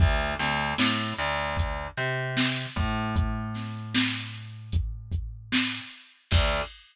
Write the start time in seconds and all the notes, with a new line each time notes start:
0.00 D2, kick, closed hi-hat
0.39 D2, snare, closed hi-hat
0.78 A2, snare
1.18 D2, snare, closed hi-hat
1.57 kick, closed hi-hat
1.97 C3, closed hi-hat
2.37 snare
2.76 A2, kick, closed hi-hat
3.16 kick, closed hi-hat
3.54 snare, closed hi-hat
3.95 snare
4.34 closed hi-hat
4.73 kick, closed hi-hat
5.12 kick, closed hi-hat
5.52 snare
5.90 closed hi-hat
6.31 D2, kick, crash